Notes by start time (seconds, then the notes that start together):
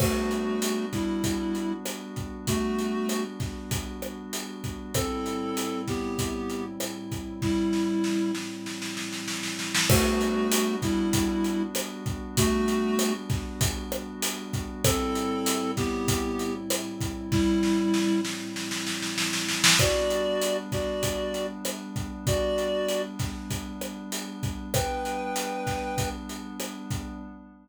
0.00 G3 A3 B3 D4 F#4, kick, cross-stick, crash
0.31 closed hi-hat
0.62 closed hi-hat
0.93 G3 E4, kick, snare, closed hi-hat
1.24 kick, snare, closed hi-hat
1.55 closed hi-hat
1.85 cross-stick, closed hi-hat
2.16 kick, closed hi-hat
2.47 A3 F#4, kick, closed hi-hat
2.79 closed hi-hat
3.09 cross-stick, closed hi-hat
3.40 kick, snare, closed hi-hat
3.71 kick, closed hi-hat
4.02 cross-stick, closed hi-hat
4.33 closed hi-hat
4.64 kick, closed hi-hat
4.94 A2 G3 C4 E4 A4, kick, cross-stick, closed hi-hat
5.26 closed hi-hat
5.57 closed hi-hat
5.88 B3 G4, kick, snare, closed hi-hat
6.19 kick, closed hi-hat
6.50 closed hi-hat
6.80 cross-stick, closed hi-hat
7.11 kick, closed hi-hat
7.42 G3 E4, kick, snare
7.73 snare
8.04 snare
8.35 snare
8.66 snare
8.82 snare
8.97 snare
9.13 snare
9.28 snare
9.43 snare
9.59 snare
9.74 snare
9.90 G3 A3 B3 D4 F#4, kick, cross-stick, crash
10.21 closed hi-hat
10.52 closed hi-hat
10.82 G3 E4, kick, snare, closed hi-hat
11.13 kick, snare, closed hi-hat
11.44 closed hi-hat
11.75 cross-stick, closed hi-hat
12.06 kick, closed hi-hat
12.37 A3 F#4, kick, closed hi-hat
12.68 closed hi-hat
12.99 cross-stick, closed hi-hat
13.30 kick, snare, closed hi-hat
13.61 kick, closed hi-hat
13.92 cross-stick, closed hi-hat
14.22 closed hi-hat
14.53 kick, closed hi-hat
14.84 A2 G3 C4 E4 A4, kick, cross-stick, closed hi-hat
15.15 closed hi-hat
15.46 closed hi-hat
15.77 B3 G4, kick, snare, closed hi-hat
16.08 kick, closed hi-hat
16.39 closed hi-hat
16.70 cross-stick, closed hi-hat
17.01 kick, closed hi-hat
17.32 G3 E4, kick, snare
17.63 snare
17.94 snare
18.25 snare
18.56 snare
18.71 snare
18.86 snare
19.02 snare
19.18 snare
19.33 snare
19.49 snare
19.64 snare
19.78 G3 B3 D4 F#4 D5, kick, cross-stick, closed hi-hat
20.10 closed hi-hat
20.41 closed hi-hat
20.72 F#4 D5, kick, snare, closed hi-hat
21.03 kick, closed hi-hat
21.34 closed hi-hat
21.65 cross-stick, closed hi-hat
21.96 kick, closed hi-hat
22.27 F#4 D5, kick, closed hi-hat
22.58 closed hi-hat
22.89 closed hi-hat
23.19 kick, snare, closed hi-hat
23.50 kick, closed hi-hat
23.81 cross-stick, closed hi-hat
24.12 closed hi-hat
24.43 kick, closed hi-hat
24.74 G3 B3 D4 B4 G5, kick, cross-stick, closed hi-hat
25.05 closed hi-hat
25.36 closed hi-hat
25.67 kick, snare, closed hi-hat
25.98 kick, closed hi-hat
26.29 closed hi-hat
26.60 cross-stick, closed hi-hat
26.90 kick, closed hi-hat